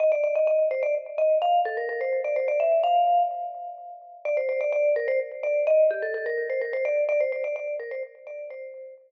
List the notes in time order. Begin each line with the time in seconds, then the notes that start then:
0.00 D#5
0.12 D5
0.24 D5
0.35 D#5
0.47 D#5
0.71 C5
0.83 D5
1.18 D#5
1.42 F5
1.65 A4
1.77 A#4
1.89 A#4
2.01 C5
2.24 D5
2.36 C5
2.48 D5
2.60 E5
2.83 F5
4.25 D5
4.37 C5
4.49 C5
4.61 D5
4.72 D5
4.96 A#4
5.08 C5
5.43 D5
5.67 D#5
5.91 G4
6.02 A4
6.14 A4
6.26 A#4
6.50 C5
6.61 A#4
6.73 C5
6.85 D5
7.09 D5
7.20 C5
7.32 C5
7.44 D5
7.56 D5
7.80 A#4
7.91 C5
8.27 D5
8.50 C5